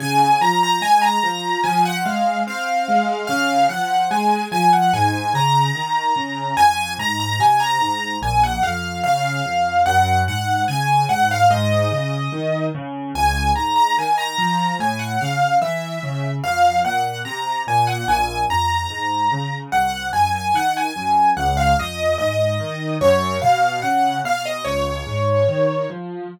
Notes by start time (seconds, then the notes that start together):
0.00 C#3 G#5
0.41 F3 A#5
0.63 A#5
0.82 G#3 G#5
1.02 A#5
1.23 F3
1.64 F3 G#5
1.85 F#5
2.05 G#3 F5
2.47 C4 F5
2.88 G#3
3.27 C#3 F5
3.69 F3 F#5
4.11 G#3 G#5
4.52 F3 G#5
4.73 F#5
4.93 G#2 G#5
5.34 C#3 A#5
5.75 D#3
6.16 C#3
6.57 F2 G#5
6.98 G#2 A#5
7.20 A#5
7.39 C3 G#5
7.60 A#5
7.80 G#2
8.22 A#1 G#5
8.43 F#5
8.63 F2 F5
9.04 C#3 F5
9.45 F2
9.86 F#2 F#5
10.28 G#2 F#5
10.68 C#3 G#5
11.09 G#2 F#5
11.31 F5
11.50 G#2 D#5
11.91 C#3
12.32 D#3
12.75 C#3
13.15 C#2 G#5
13.55 G#2 A#5
13.76 A#5
13.98 D#3 G#5
14.18 A#5
14.38 F3
14.79 A2 G#5
14.99 F#5
15.21 C#3 F5
15.61 E3 E5
16.03 C#3
16.44 F2 F5
16.85 A#2 F#5
17.25 C3 A#5
17.67 A#2 G#5
17.87 F#5
18.08 A#1 G#5
18.50 F2 A#5
18.90 G#2
19.32 C#3
19.72 C2 F#5
20.13 F#2 G#5
20.36 G#5
20.54 D#3 F#5
20.77 G#5
20.96 F#2
21.37 C#2 F#5
21.57 F5
21.78 F2 D#5
22.18 G#2 D#5
22.60 D#3
23.01 F#2 C#5
23.42 B2 F5
23.82 C#3 F#5
24.24 B2 F5
24.46 D#5
24.65 C#2 C#5
25.07 G#2
25.48 D#3
25.90 F3